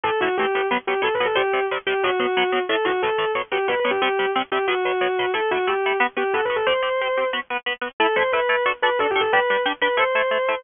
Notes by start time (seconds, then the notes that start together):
0.04 A2 E3 A3 A4
0.21 A2 E3 A3 F#4
0.38 A2 E3 A3 G4
0.55 A2 E3 A3
0.71 B2 F#3 B3
0.87 B2 F#3 B3 G4
1.02 B2 F#3 B3 A4
1.14 B4
1.20 B2 F#3 B3
1.26 A4
1.35 C3 G3 C4 G4
1.53 C3 G3 C4
1.71 C3 G3 C4
1.87 C3 G3 C4 G4
2.03 B2 F#3 B3 F#4
2.20 B2 F#3 B3
2.37 B2 F#3 B3
2.52 B2 F#3 B3
2.69 A2 E3 A3 A4
2.85 A2 E3 A3 F#4
3.02 A2 E3 A3 A4
3.18 A2 E3 A3
3.35 B2 F#3 B3
3.52 B2 F#3 B3 G4
3.68 B2 F#3 B3 B4
3.80 B4
3.85 B2 F#3 B3
3.91 G4
4.02 C3 G3 C4 G4
4.19 C3 G3 C4
4.35 C3 G3 C4
4.52 C3 G3 C4 G4
4.68 B2 F#3 B3 F#4
4.85 B2 F#3 B3
5.01 B2 F#3 B3
5.19 B2 F#3 B3
5.34 A3 E4 A4
5.51 A3 E4 F#4 A4
5.67 A3 E4 G4 A4
5.86 A3 E4 A4
6.00 B3 F#4 B4
6.17 B3 F#4 G4 B4
6.34 B3 F#4 A4 B4
6.45 B4
6.50 B3 F#4 B4
6.56 A4
6.67 C4 G4 C5
6.83 C4 G4 C5
7.01 C4 G4 C5
7.17 C4 G4 C5
7.33 B3 F#4 B4
7.50 B3 F#4 B4
7.66 B3 F#4 B4
7.81 B3 F#4 B4
8.00 A3 E4 A4
8.16 A3 E4 A4 C5
8.33 A3 E4 A4 B4
8.49 A3 E4 A4
8.66 D4 F#4 A4
8.82 D4 F#4 A4 B4
8.99 D4 F#4 A4
9.10 G4
9.16 D4 F#4 A4
9.21 A4
9.33 G3 D4 G4 B4
9.50 G3 D4 G4
9.66 G3 D4 G4
9.81 G3 D4 G4 B4
9.97 A3 E4 A4 C5
10.15 A3 E4 A4
10.31 A3 E4 A4
10.48 A3 E4 A4